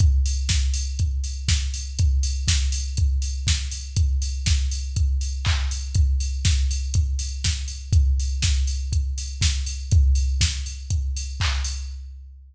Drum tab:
HH |xo-oxo-o|xo-oxo-o|xo-oxo-o|xo-oxo-o|
CP |--------|--------|------x-|--------|
SD |--o---o-|--o---o-|--o-----|--o---o-|
BD |o-o-o-o-|o-o-o-o-|o-o-o-o-|o-o-o-o-|

HH |xo-oxo-o|xo-oxo-o|
CP |--------|------x-|
SD |--o---o-|--o-----|
BD |o-o-o-o-|o-o-o-o-|